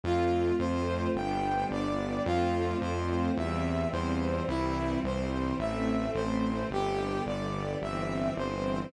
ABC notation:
X:1
M:4/4
L:1/8
Q:1/4=54
K:C
V:1 name="Brass Section"
F c g d F c e c | E c e c G d e c |]
V:2 name="String Ensemble 1"
[A,CF]2 [G,B,D]2 [F,A,C]2 [E,G,C]2 | [E,G,C]2 [E,A,C]2 [D,G,B,]2 [E,G,C]2 |]
V:3 name="Synth Bass 1" clef=bass
F,, F,, G,,, G,,, F,, F,, E,, E,, | C,, C,, A,,, A,,, G,,, G,,, G,,, G,,, |]